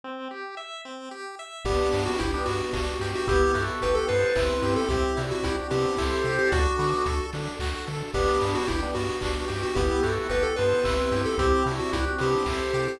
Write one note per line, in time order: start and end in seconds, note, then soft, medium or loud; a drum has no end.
0.04 0.28 C4 medium
0.31 0.55 G4 medium
0.57 0.81 E5 medium
0.85 1.09 C4 soft
1.11 1.35 G4 medium
1.39 1.63 E5 medium
1.65 1.80 G1 loud
1.65 1.89 B3 medium
1.65 2.09 B3 loud
1.65 3.26 B3 medium
1.65 2.09 D4 loud
1.65 3.26 D4 medium
1.65 2.04 G4 loud
1.65 3.26 G4 medium
1.65 kick loud
1.65 crash loud
1.93 2.08 G2 loud
1.93 2.17 D4 medium
1.93 open hi-hat medium
2.06 2.18 F#4 loud
2.19 2.36 G1 loud
2.19 2.32 E4 medium
2.19 2.44 G4 medium
2.19 kick medium
2.19 closed hi-hat loud
2.34 2.47 B3 loud
2.34 2.47 D4 loud
2.45 2.62 G2 medium
2.45 2.70 B3 medium
2.45 3.11 F#4 medium
2.45 open hi-hat medium
2.73 2.89 G1 medium
2.73 2.97 D4 medium
2.73 kick medium
2.73 clap loud
3.00 3.15 G2 medium
3.00 3.25 G4 medium
3.00 open hi-hat medium
3.15 3.28 F#4 medium
3.27 3.44 G1 loud
3.27 3.52 B3 medium
3.27 4.88 B3 medium
3.27 3.54 E4 loud
3.27 4.88 E4 medium
3.27 3.54 G4 loud
3.27 4.88 G4 medium
3.27 3.64 G4 loud
3.27 kick loud
3.27 closed hi-hat loud
3.54 3.70 G2 medium
3.54 3.79 E4 medium
3.54 3.99 F#4 medium
3.54 3.99 A4 loud
3.54 open hi-hat medium
3.81 3.98 G1 loud
3.81 4.06 G4 medium
3.81 3.96 B4 medium
3.81 kick medium
3.81 closed hi-hat loud
3.95 4.08 A4 loud
4.08 4.25 G2 medium
4.08 4.33 B3 medium
4.08 4.31 A4 medium
4.08 4.74 B4 medium
4.08 4.31 C5 medium
4.08 open hi-hat medium
4.35 4.51 G1 medium
4.35 4.80 C4 medium
4.35 4.80 E4 loud
4.35 4.61 E4 medium
4.35 kick loud
4.35 clap loud
4.62 4.77 G2 loud
4.62 4.87 G4 medium
4.62 open hi-hat medium
4.76 4.89 A4 loud
4.88 5.04 C2 loud
4.88 5.13 C4 medium
4.88 6.50 C4 medium
4.88 6.50 E4 loud
4.88 5.16 E4 loud
4.88 5.23 G4 loud
4.88 6.50 G4 loud
4.88 5.16 G4 loud
4.88 kick loud
4.88 closed hi-hat loud
5.17 5.33 C3 loud
5.17 5.70 D4 medium
5.17 5.41 E4 medium
5.17 5.70 F#4 medium
5.17 open hi-hat medium
5.31 5.44 F#4 medium
5.43 5.60 C2 medium
5.43 5.57 E4 loud
5.43 5.68 G4 medium
5.43 kick medium
5.43 closed hi-hat loud
5.70 5.86 C3 loud
5.70 5.95 B3 medium
5.70 5.95 C4 medium
5.70 5.95 D4 medium
5.70 6.37 G4 loud
5.70 open hi-hat medium
5.97 6.14 C2 medium
5.97 6.22 E4 medium
5.97 6.48 A4 medium
5.97 6.48 C5 loud
5.97 kick medium
5.97 clap loud
6.24 6.39 C3 medium
6.24 6.50 G4 medium
6.24 open hi-hat medium
6.39 6.51 G4 medium
6.51 6.67 D2 loud
6.51 6.76 D4 loud
6.51 6.76 D4 medium
6.51 8.13 D4 medium
6.51 6.76 F#4 loud
6.51 8.13 F#4 medium
6.51 7.26 F#4 loud
6.51 8.13 A4 medium
6.51 kick loud
6.51 closed hi-hat loud
6.79 6.94 D3 loud
6.79 7.03 B3 medium
6.79 7.03 D4 loud
6.79 7.03 F#4 medium
6.79 open hi-hat medium
7.06 7.21 D2 medium
7.06 7.31 A4 medium
7.06 kick medium
7.06 closed hi-hat loud
7.33 7.48 D3 medium
7.33 7.59 D4 medium
7.33 open hi-hat medium
7.59 7.74 D2 medium
7.59 7.85 F#4 medium
7.59 kick medium
7.59 clap loud
7.87 8.03 D3 medium
7.87 8.11 A4 medium
7.87 open hi-hat medium
8.14 8.29 G1 loud
8.14 9.75 B3 medium
8.14 8.58 B3 loud
8.14 8.39 B3 medium
8.14 9.75 D4 medium
8.14 8.58 D4 loud
8.14 9.75 G4 medium
8.14 8.53 G4 loud
8.14 kick loud
8.14 crash loud
8.41 8.57 G2 loud
8.41 8.67 D4 medium
8.41 open hi-hat medium
8.55 8.68 F#4 loud
8.67 8.85 G1 loud
8.67 8.81 E4 medium
8.67 8.91 G4 medium
8.67 kick medium
8.67 closed hi-hat loud
8.82 8.95 B3 loud
8.82 8.95 D4 loud
8.95 9.10 G2 medium
8.95 9.19 B3 medium
8.95 9.61 F#4 medium
8.95 open hi-hat medium
9.21 9.37 G1 medium
9.21 9.45 D4 medium
9.21 kick medium
9.21 clap loud
9.48 9.65 G2 medium
9.48 9.72 G4 medium
9.48 open hi-hat medium
9.63 9.76 F#4 medium
9.75 9.91 G1 loud
9.75 10.00 B3 medium
9.75 11.37 B3 medium
9.75 11.37 E4 medium
9.75 10.03 E4 loud
9.75 10.10 G4 loud
9.75 11.37 G4 medium
9.75 10.03 G4 loud
9.75 kick loud
9.75 closed hi-hat loud
10.03 10.19 G2 medium
10.03 10.27 E4 medium
10.03 10.47 F#4 medium
10.03 10.47 A4 loud
10.03 open hi-hat medium
10.29 10.44 G1 loud
10.29 10.54 G4 medium
10.29 10.43 B4 medium
10.29 kick medium
10.29 closed hi-hat loud
10.43 10.56 A4 loud
10.56 10.74 G2 medium
10.56 10.83 B3 medium
10.56 10.80 A4 medium
10.56 11.22 B4 medium
10.56 10.80 C5 medium
10.56 open hi-hat medium
10.84 11.00 G1 medium
10.84 11.29 C4 medium
10.84 11.29 E4 loud
10.84 11.10 E4 medium
10.84 kick loud
10.84 clap loud
11.12 11.26 G2 loud
11.12 11.36 G4 medium
11.12 open hi-hat medium
11.26 11.38 A4 loud
11.38 11.53 C2 loud
11.38 11.63 C4 medium
11.38 13.00 C4 medium
11.38 11.64 E4 loud
11.38 13.00 E4 loud
11.38 11.64 G4 loud
11.38 11.72 G4 loud
11.38 13.00 G4 loud
11.38 kick loud
11.38 closed hi-hat loud
11.66 11.81 C3 loud
11.66 12.19 D4 medium
11.66 11.91 E4 medium
11.66 12.19 F#4 medium
11.66 open hi-hat medium
11.79 11.92 F#4 medium
11.93 12.08 C2 medium
11.93 12.05 E4 loud
11.93 12.18 G4 medium
11.93 kick medium
11.93 closed hi-hat loud
12.18 12.36 C3 loud
12.18 12.44 B3 medium
12.18 12.44 C4 medium
12.18 12.44 D4 medium
12.18 12.87 G4 loud
12.18 open hi-hat medium
12.46 12.61 C2 medium
12.46 12.72 E4 medium
12.46 12.97 A4 medium
12.46 12.97 C5 loud
12.46 kick medium
12.46 clap loud
12.73 12.88 C3 medium
12.73 12.98 G4 medium
12.73 open hi-hat medium
12.88 13.00 G4 medium